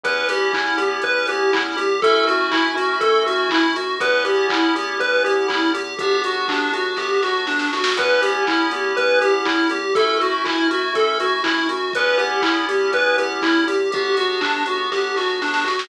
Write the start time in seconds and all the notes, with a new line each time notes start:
0.04 E2 B3 C#4 E4 G4 B4, kick, closed hi-hat
0.29 E2 G4, open hi-hat
0.53 E2 E4, kick, clap
0.77 E2 G4, open hi-hat
1.02 E2 B4, kick, closed hi-hat
1.27 E2 G4, open hi-hat
1.53 E2 E4, kick, clap
1.77 E2 G4, open hi-hat
2.02 F#2 A3 C#4 E4 F#4 A4, kick, closed hi-hat
2.27 F#2 F#4, open hi-hat
2.51 F#2 E4, kick, clap
2.75 F#2 F#4, open hi-hat
3.01 F#2 A4, kick, closed hi-hat
3.26 F#2 F#4, open hi-hat
3.50 F#2 E4, kick, clap
3.76 F#2 F#4, open hi-hat
4.00 E2 B3 C#4 E4 G4 B4, kick, closed hi-hat
4.25 E2 G4, open hi-hat
4.49 E2 E4, kick, clap
4.75 E2 G4, open hi-hat
4.99 E2 B4, kick, closed hi-hat
5.24 E2 G4, open hi-hat
5.48 E2 E4, kick, clap
5.73 E2 G4, open hi-hat
5.99 G1 B3 D4 F#4 G4, kick, closed hi-hat
6.24 G1 F#4, open hi-hat
6.48 G1 D4, kick, clap
6.73 G1 F#4, open hi-hat
6.97 G1 G4, kick, snare
7.23 G1 F#4, snare
7.46 G1 D4, snare
7.59 snare
7.73 G1 F#4, snare
7.84 snare
7.97 E2 B3 C#4 E4 G4 B4, kick, closed hi-hat
8.22 E2 G4, open hi-hat
8.47 E2 E4, kick, clap
8.71 E2 G4, open hi-hat
8.97 E2 B4, kick, closed hi-hat
9.20 E2 G4, open hi-hat
9.45 E2 E4, kick, clap
9.69 E2 G4, open hi-hat
9.95 F#2 A3 C#4 E4 F#4 A4, kick, closed hi-hat
10.21 F#2 F#4, open hi-hat
10.45 F#2 E4, kick, clap
10.70 F#2 F#4, open hi-hat
10.94 F#2 A4, kick, closed hi-hat
11.20 F#2 F#4, open hi-hat
11.44 F#2 E4, kick, clap
11.69 F#2 F#4, open hi-hat
11.93 E2 B3 C#4 E4 G4 B4, kick, closed hi-hat
12.18 E2 G4, open hi-hat
12.42 E2 E4, kick, clap
12.69 E2 G4, open hi-hat
12.92 E2 B4, kick, closed hi-hat
13.17 E2 G4, open hi-hat
13.42 E2 E4, kick, clap
13.67 E2 G4, open hi-hat
13.92 G1 B3 D4 F#4 G4, kick, closed hi-hat
14.17 G1 F#4, open hi-hat
14.41 G1 D4, kick, clap
14.66 G1 F#4, open hi-hat
14.92 G1 G4, kick, snare
15.16 G1 F#4, snare
15.42 G1 D4, snare
15.54 snare
15.64 G1 F#4, snare
15.79 snare